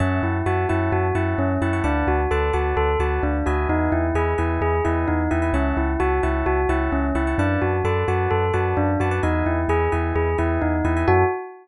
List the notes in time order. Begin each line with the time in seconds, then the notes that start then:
0.00 F#2 C#4 C#5 E5 F#5 A5
0.22 F#2 E4
0.46 F#2 F#4 C#5 E5 F#5 A5
0.69 F#2 E4 C#5 E5 F#5 A5
0.92 F#2 F#4
1.15 F#2 E4 C#5 E5 F#5 A5
1.38 F#2 C#4
1.61 F#2 E4 C#5 E5 F#5 A5
1.73 C#5 E5 F#5 A5
1.84 D2 D4 B4 D5 F#5 A5
2.07 D2 F#4
2.31 D2 A4 B4 D5 F#5 A5
2.53 D2 F#4 B4 D5 F#5 A5
2.77 D2 A4
2.99 D2 F#4 B4 D5 F#5 A5
3.23 D2 D4
3.46 D2 F#4 B4 D#5 E5 G#5
3.69 E2 D#4
3.92 E2 E4
4.14 E2 G#4 B4 D#5 E5 G#5
4.38 E2 E4 B4 D#5 E5 G#5
4.61 E2 G#4
4.85 E2 E4 B4 D#5 E5 G#5
5.08 E2 D#4
5.31 E2 E4 B4 D#5 E5 G#5
5.42 B4 D#5 E5 G#5
5.53 C#2 C#4 C#5 E5 F#5 A5
5.77 C#2 E4
6.00 C#2 F#4 C#5 E5 F#5 A5
6.23 C#2 E4 C#5 E5 F#5 A5
6.46 C#2 F#4
6.69 C#2 E4 C#5 E5 F#5 A5
6.92 C#2 C#4
7.15 C#2 E4 C#5 E5 F#5 A5
7.27 C#5 E5 F#5 A5
7.38 F#2 D4 B4 D5 F#5 A5
7.62 F#2 F#4
7.84 F#2 A4 B4 D5 F#5 A5
8.08 F#2 F#4 B4 D5 F#5 A5
8.31 F#2 A4
8.53 F#2 F#4 B4 D5 F#5 A5
8.77 F#2 D4
9.00 F#2 F#4 B4 D5 F#5 A5
9.11 B4 D5 F#5 A5
9.23 E2 D#4 B4 D#5 E5 G#5
9.46 E2 E4
9.68 E2 G#4 B4 D#5 E5 G#5
9.92 E2 E4 B4 D#5 E5 G#5
10.15 E2 G#4
10.38 E2 E4 B4 D#5 E5 G#5
10.62 E2 D#4
10.84 E2 E4 B4 D#5 E5 G#5
10.97 B4 D#5 E5 G#5
11.07 F#2 C#4 E4 F#4 A4